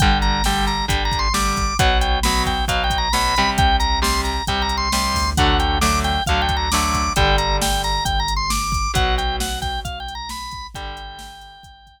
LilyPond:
<<
  \new Staff \with { instrumentName = "Drawbar Organ" } { \time 4/4 \key g \major \tempo 4 = 134 g''8 ais''8 g''8 ais''8 \tuplet 3/2 { g''8 ais''8 c'''8 } d'''4 | fis''8 g''8 b''8 g''8 \tuplet 3/2 { f''8 g''8 ais''8 } b''4 | g''8 ais''8 c'''8 ais''8 \tuplet 3/2 { g''8 ais''8 c'''8 } c'''4 | fis''8 g''8 d'''8 g''8 \tuplet 3/2 { f''8 g''8 ais''8 } d'''4 |
g''8 ais''8 g''8 ais''8 \tuplet 3/2 { g''8 ais''8 c'''8 } d'''4 | fis''8 g''8 fis''8 g''8 \tuplet 3/2 { f''8 g''8 ais''8 } b''4 | g''2. r4 | }
  \new Staff \with { instrumentName = "Acoustic Guitar (steel)" } { \time 4/4 \key g \major <d g>4 <d g>4 <d g>4 <d g>4 | <b, fis>4 <b, fis>4 <b, fis>4 <b, fis>8 <c g>8~ | <c g>4 <c g>4 <c g>4 <c g>4 | <d fis a>4 <d fis a>4 <d fis a>4 <d fis a>4 |
<d g>1 | <b, fis>1 | <d g>1 | }
  \new Staff \with { instrumentName = "Synth Bass 1" } { \clef bass \time 4/4 \key g \major g,,2 g,,2 | b,,2 b,,2 | c,2 c,4. d,8~ | d,2 d,2 |
g,,2 g,,2 | b,,2 b,,2 | g,,2 g,,2 | }
  \new DrumStaff \with { instrumentName = "Drums" } \drummode { \time 4/4 <hh bd>8 hh8 sn8 hh8 <hh bd>8 <hh bd>8 sn8 <hh bd>8 | <hh bd>8 hh8 sn8 <hh bd>8 <hh bd>8 <hh bd>8 sn8 hh8 | <hh bd>8 hh8 sn8 hh8 <hh bd>8 hh8 sn8 <hho bd>8 | <hh bd>8 hh8 sn8 hh8 <hh bd>8 <hh bd>8 sn8 <hh bd>8 |
<hh bd>8 hh8 sn8 hh8 <hh bd>8 hh8 sn8 <hh bd>8 | <hh bd>8 hh8 sn8 <hh bd>8 <hh bd>8 hh8 sn8 <hh bd>8 | <hh bd>8 hh8 sn8 hh8 <hh bd>8 <hh bd>8 r4 | }
>>